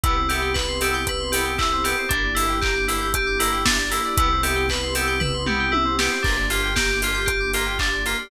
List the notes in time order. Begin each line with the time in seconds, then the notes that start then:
0.04 C2 B3 C4 E4 G4 B4, kick, closed hi-hat
0.16 C5
0.29 B3 C4 E4 G4 E5, open hi-hat
0.42 G5
0.54 B4 B5, kick, clap
0.69 C6
0.81 B3 C4 E4 G4 E6, open hi-hat
0.94 G6
1.07 B4 E6, kick, closed hi-hat
1.20 C6
1.32 B3 C4 E4 G4 B5, open hi-hat
1.45 G5
1.58 E4 E5, kick, clap
1.72 C5
1.84 B3 C4 E4 G4 B4, open hi-hat
1.98 C5
2.09 G1 A#3 D4 E4 G4 A#4, kick, closed hi-hat
2.24 D5
2.35 A#3 D4 E4 G4 E5, open hi-hat
2.48 G5
2.61 G4 A#5, kick, clap
2.75 D6
2.88 A#3 D4 E4 G4 E6, open hi-hat
3.01 G6
3.14 G4 E6, kick, closed hi-hat
3.27 D6
3.39 A#3 D4 E4 G4 A#5, open hi-hat
3.52 G5
3.65 D4 E5, kick, snare
3.79 D5
3.90 A#3 D4 E4 G4 A#4, open hi-hat
4.05 D5
4.17 C2 B3 C4 E4 G4 B4, kick, closed hi-hat
4.32 C5
4.43 B3 C4 E4 G4 E5, open hi-hat
4.56 G5
4.69 B4 B5, kick, clap
4.83 C6
4.95 B3 C4 E4 G4 E6, open hi-hat
5.07 G6
5.20 B4 E6, kick, floor tom
5.34 C6
5.46 B3 C4 E4 G4 B5, mid tom
5.60 G5
5.72 E4 E5, high tom
5.85 C5
5.99 B3 C4 E4 G4 B4, snare
6.12 C5
6.23 G1 A#3 D4 F4 G4 A#4, kick, crash
6.37 D5
6.50 A#3 D4 F4 G4 F5, open hi-hat
6.63 G5
6.76 G4 A#5, kick, snare
6.89 D6
7.02 A#3 D4 F4 G4 F6, open hi-hat
7.14 G6
7.26 G4 F6, kick, closed hi-hat
7.40 D6
7.53 A#3 D4 F4 G4 A#5, open hi-hat
7.66 G5
7.79 D4 F5, kick, clap
7.94 D5
8.06 A#3 D4 F4 G4 A#4, open hi-hat
8.19 D5